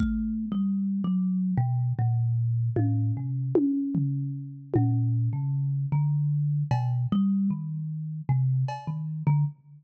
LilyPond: <<
  \new Staff \with { instrumentName = "Kalimba" } { \time 6/4 \tempo 4 = 76 \tuplet 3/2 { a4 g4 ges4 } b,8 bes,4 a,8 c8 r4. | bes,8. des8. d4 b,8 g8 ees4 c8 r16 ees8 d16 | }
  \new DrumStaff \with { instrumentName = "Drums" } \drummode { \time 6/4 bd4 r4 r4 r8 tommh8 r8 tommh8 tomfh4 | tommh4 r4 r8 cb8 r4 r4 cb4 | }
>>